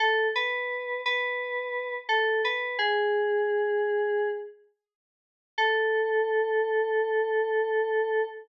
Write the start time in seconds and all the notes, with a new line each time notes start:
0.00 A4
0.35 B4
1.06 B4
2.09 A4
2.45 B4
2.79 G#4
5.58 A4